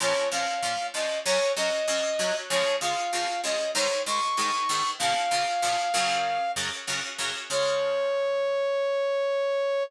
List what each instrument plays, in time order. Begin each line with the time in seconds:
0.00 acoustic guitar (steel) A#2 F3 C#4, brass section C#5
0.31 acoustic guitar (steel) A#2 F3 C#4, brass section F5
0.62 acoustic guitar (steel) A#2 F3 C#4
0.94 acoustic guitar (steel) A#2 F3 C#4, brass section D#5
1.25 acoustic guitar (steel) F#2 F#3 C#4, brass section C#5
1.56 acoustic guitar (steel) F#2 F#3 C#4, brass section D#5
1.88 acoustic guitar (steel) F#2 F#3 C#4
2.19 acoustic guitar (steel) F#2 F#3 C#4
2.50 acoustic guitar (steel) C#3 F3 G#3, brass section C#5
2.81 acoustic guitar (steel) C#3 F3 G#3, brass section F5
3.13 acoustic guitar (steel) C#3 F3 G#3
3.44 acoustic guitar (steel) C#3 F3 G#3, brass section D#5
3.75 acoustic guitar (steel) G#2 D#3 G#3, brass section C#5
4.06 acoustic guitar (steel) G#2 D#3 G#3, brass section C#6
4.37 acoustic guitar (steel) G#2 D#3 G#3
4.69 acoustic guitar (steel) G#2 D#3 G#3
4.99 acoustic guitar (steel) A#2 C#3 F3, brass section F5
5.31 acoustic guitar (steel) A#2 C#3 F3
5.62 acoustic guitar (steel) A#2 C#3 F3
5.94 acoustic guitar (steel) F#2 C#3 F#3
6.56 acoustic guitar (steel) F#2 C#3 F#3
6.87 acoustic guitar (steel) F#2 C#3 F#3
7.18 acoustic guitar (steel) F#2 C#3 F#3
7.50 acoustic guitar (steel) C#3 F3 G#3, brass section C#5